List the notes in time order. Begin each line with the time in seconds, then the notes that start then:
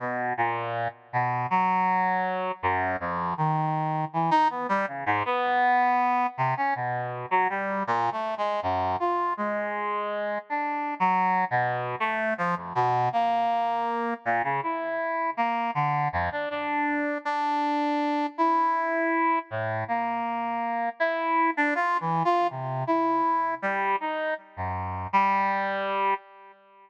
0.00 B2
0.37 A#2
1.13 B2
1.50 F#3
2.63 F#2
3.00 F2
3.37 D#3
4.13 E3
4.31 D#4
4.50 B3
4.69 G3
4.87 C#3
5.06 G#2
5.25 B3
6.38 C3
6.57 C#4
6.75 B2
7.31 F#3
7.50 G3
7.87 A#2
8.12 A3
8.38 G#3
8.62 F#2
9.00 F4
9.37 G#3
10.50 D4
11.00 F#3
11.51 B2
12.00 A3
12.38 F3
12.56 F2
12.75 B2
13.13 A#3
14.25 A#2
14.44 C#3
14.63 E4
15.37 A#3
15.75 D3
16.13 F2
16.32 D4
16.50 D4
17.25 D4
18.38 E4
19.50 A2
19.88 A#3
21.00 E4
21.57 D4
21.75 F4
22.00 E3
22.25 F4
22.50 C3
22.87 E4
23.62 G3
24.00 D#4
24.57 F#2
25.13 G3